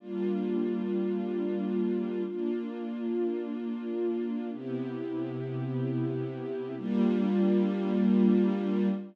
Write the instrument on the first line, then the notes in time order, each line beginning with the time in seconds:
string ensemble 1
0.00 G3 A#3 D4 F4
2.26 A#3 D4 F4
4.52 C3 B3 E4 G4
6.78 G3 A#3 D4 F4